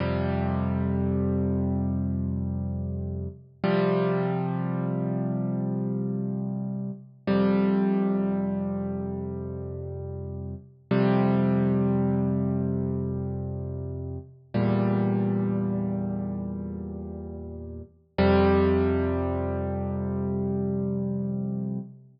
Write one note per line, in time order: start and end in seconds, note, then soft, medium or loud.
0.00 3.27 F2 medium
0.00 3.27 C3 medium
0.00 3.27 G3 medium
3.64 6.91 C3 medium
3.64 6.91 F3 medium
3.64 6.91 G3 medium
7.27 10.55 F2 medium
7.27 10.55 C3 medium
7.27 10.55 G3 medium
10.91 14.18 F2 medium
10.91 14.18 C3 medium
10.91 14.18 G3 medium
14.54 17.82 E2 medium
14.54 17.82 A#2 medium
14.54 17.82 G3 medium
18.18 21.79 F2 medium
18.18 21.79 C3 loud
18.18 21.79 G3 loud